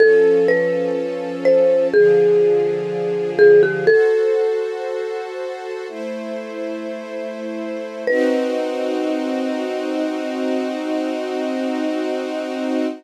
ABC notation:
X:1
M:4/4
L:1/16
Q:1/4=62
K:Bphr
V:1 name="Marimba"
A2 B4 c2 _A6 A G | "^rit." A12 z4 | B16 |]
V:2 name="String Ensemble 1"
[=F,^CA]8 [D,F,_A]8 | "^rit." [FAc]8 [A,Ec]8 | [C_E_G]16 |]